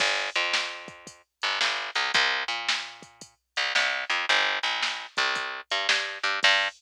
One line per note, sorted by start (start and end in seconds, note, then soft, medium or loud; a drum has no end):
0.00 0.30 G1 medium
0.00 kick loud
0.00 crash loud
0.35 1.22 F2 medium
0.35 closed hi-hat medium
0.53 snare loud
0.88 kick loud
0.88 closed hi-hat medium
1.07 kick loud
1.07 closed hi-hat loud
1.42 1.59 G1 medium
1.42 closed hi-hat medium
1.61 1.90 G1 medium
1.61 snare loud
1.95 2.11 C2 medium
1.95 closed hi-hat medium
2.14 2.44 C2 loud
2.14 kick loud
2.14 closed hi-hat loud
2.48 3.34 A#2 medium
2.48 closed hi-hat medium
2.69 snare loud
3.02 kick loud
3.02 closed hi-hat medium
3.21 kick medium
3.21 closed hi-hat loud
3.56 3.73 C2 medium
3.56 closed hi-hat medium
3.75 4.05 C2 medium
3.75 snare loud
4.10 4.26 F2 medium
4.10 closed hi-hat medium
4.29 4.59 G1 medium
4.29 closed hi-hat loud
4.63 5.06 A#1 medium
4.63 closed hi-hat medium
4.82 snare loud
5.17 5.61 C2 medium
5.17 kick loud
5.17 closed hi-hat medium
5.35 kick loud
5.35 closed hi-hat loud
5.70 5.87 G2 medium
5.70 closed hi-hat medium
5.89 6.18 G2 medium
5.89 snare loud
6.23 6.40 G2 medium
6.23 closed hi-hat medium
6.43 6.68 G2 loud
6.43 kick loud
6.43 crash loud